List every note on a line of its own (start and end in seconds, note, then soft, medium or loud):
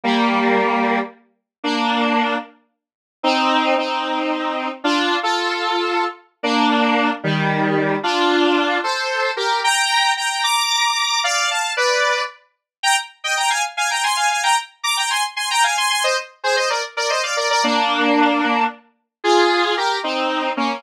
0.04 0.99 G3 loud
0.04 0.99 A#3 loud
1.64 2.36 A#3 medium
1.64 2.36 D4 loud
3.23 3.75 C4 loud
3.23 3.75 D#4 loud
3.77 4.69 C4 medium
3.77 4.69 D#4 medium
4.84 5.17 D4 medium
4.84 5.17 F4 loud
5.23 6.05 F4 medium
5.23 6.05 A4 medium
6.43 7.10 A#3 loud
6.43 7.10 D4 loud
7.24 7.96 D#3 medium
7.24 7.96 G3 loud
8.03 8.78 D4 medium
8.03 8.78 F4 loud
8.84 9.31 A4 medium
8.84 9.31 C5 medium
9.37 9.61 G4 medium
9.37 9.61 A#4 medium
9.64 10.12 G5 medium
9.64 10.12 A#5 loud
10.17 10.43 G5 medium
10.17 10.43 A#5 medium
10.44 11.21 A#5 medium
10.44 11.21 D6 medium
11.24 11.49 D5 medium
11.24 11.49 F5 loud
11.51 11.73 F5 medium
11.51 11.73 A5 medium
11.77 12.22 B4 medium
11.77 12.22 D5 medium
12.83 12.96 G5 loud
12.83 12.96 A#5 loud
13.24 13.37 D#5 medium
13.24 13.37 G5 medium
13.37 13.50 G5 medium
13.37 13.50 A#5 medium
13.50 13.63 F5 medium
13.50 13.63 G#5 medium
13.77 13.90 F5 medium
13.77 13.90 G#5 medium
13.91 14.03 G5 medium
13.91 14.03 A#5 medium
14.04 14.16 G#5 medium
14.04 14.16 C6 medium
14.16 14.29 F5 medium
14.16 14.29 G#5 medium
14.30 14.43 F5 medium
14.30 14.43 G#5 medium
14.43 14.56 G5 medium
14.43 14.56 A#5 medium
14.84 14.96 A#5 medium
14.84 14.96 D6 medium
14.97 15.10 G5 medium
14.97 15.10 A#5 medium
15.10 15.23 G#5 medium
15.10 15.23 C6 medium
15.36 15.49 G#5 medium
15.36 15.49 C6 medium
15.51 15.63 G5 medium
15.51 15.63 A#5 loud
15.64 15.76 F5 medium
15.64 15.76 G#5 medium
15.77 15.90 G#5 medium
15.77 15.90 C6 medium
15.90 16.03 G#5 medium
15.90 16.03 C6 medium
16.04 16.16 C5 medium
16.04 16.16 D#5 medium
16.44 16.56 G#4 medium
16.44 16.56 C5 loud
16.56 16.69 C5 medium
16.56 16.69 D#5 medium
16.70 16.83 A#4 medium
16.70 16.83 D5 medium
16.97 17.09 A#4 medium
16.97 17.09 D5 medium
17.10 17.23 C5 medium
17.10 17.23 D#5 medium
17.23 17.36 D5 medium
17.23 17.36 F5 medium
17.37 17.49 A#4 medium
17.37 17.49 D5 medium
17.50 17.63 A#4 medium
17.50 17.63 D5 loud
17.64 18.64 A#3 loud
17.64 18.64 D4 loud
19.24 19.75 F4 medium
19.24 19.75 G#4 loud
19.77 19.99 G4 medium
19.77 19.99 A#4 medium
20.04 20.51 C4 medium
20.04 20.51 D#4 medium
20.57 20.81 A#3 medium
20.57 20.81 C#4 medium